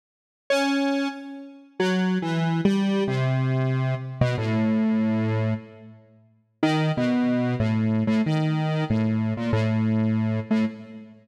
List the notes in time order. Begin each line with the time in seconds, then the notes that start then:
0.50 C#4
1.80 F#3
2.22 E3
2.65 G3
3.08 C3
4.21 B2
4.38 A2
6.63 D#3
6.97 B2
7.60 A2
8.07 A2
8.26 D#3
8.90 A2
9.37 A#2
9.53 A2
10.51 A2